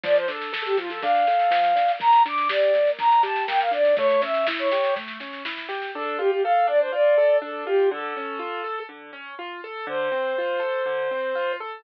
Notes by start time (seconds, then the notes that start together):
0.03 F3 D5, kick, snare
0.16 C5, snare
0.28 D4 A4, snare
0.41 snare
0.53 A4, snare
0.65 G4, snare
0.77 F3 F4, snare
0.90 A4, snare
1.02 D4 F5, kick, snare
1.15 snare
1.27 A4, snare
1.39 snare
1.51 F3, snare
1.64 snare
1.76 D4, snare
1.88 snare
1.99 A#3 A#5, kick, snare
2.12 snare
2.25 D4 D6, snare
2.38 snare
2.49 G4 D5, snare
2.62 snare
2.74 A#3, snare
2.87 snare
2.99 D4 A#5, kick, snare
3.11 snare
3.23 G4 A5, snare
3.36 snare
3.48 A#3 G5, snare
3.60 F5, snare
3.71 D4 D5, snare
3.85 snare
3.97 A3 C#5, kick, snare
4.09 snare
4.22 C#4 E5, snare
4.34 snare
4.47 E4, snare
4.59 C#5, snare
4.71 G4, snare
4.84 snare
4.96 A3, kick, snare
5.08 snare
5.20 C#4, snare
5.33 snare
5.45 E4, snare
5.57 snare
5.69 G4, snare
5.82 snare
5.94 D4 A4
6.19 F4 G4
6.31 G4
6.43 A4 F5
6.67 D4 D5
6.80 C5
6.92 F4 D5
7.18 A4
7.42 D4 A4
7.66 F4 G4
7.91 D3 A4
8.16 C#4
8.39 F4
8.64 A4
8.89 D3
9.13 C#4
9.39 F4
9.64 A4
9.87 D3 C5
10.12 C4
10.38 F4
10.60 A4
10.86 D3
11.11 C4
11.35 F4
11.60 A4